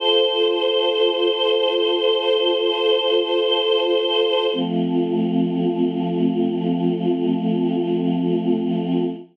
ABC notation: X:1
M:4/4
L:1/8
Q:1/4=53
K:F
V:1 name="Choir Aahs"
[FAc]8 | [F,A,C]8 |]